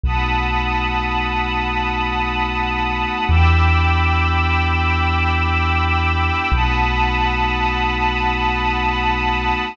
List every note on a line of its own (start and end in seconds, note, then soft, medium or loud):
0.04 3.05 B1 medium
0.04 3.26 A3 medium
0.04 3.26 B3 medium
0.04 3.26 D#4 medium
0.04 3.26 F#4 medium
0.04 3.26 F#5 medium
0.04 3.26 A5 medium
0.04 3.26 B5 medium
0.04 3.26 D#6 medium
3.28 6.30 E2 loud
3.28 6.50 B3 medium
3.28 6.50 D4 medium
3.28 6.50 E4 medium
3.28 6.50 G4 medium
3.28 6.50 G5 medium
3.28 6.50 B5 medium
3.28 6.50 D6 medium
3.28 6.50 E6 medium
6.52 9.53 B1 loud
6.52 9.75 A3 medium
6.52 9.75 B3 medium
6.52 9.75 D#4 medium
6.52 9.75 F#4 medium
6.52 9.75 F#5 medium
6.52 9.75 A5 medium
6.52 9.75 B5 medium
6.52 9.75 D#6 medium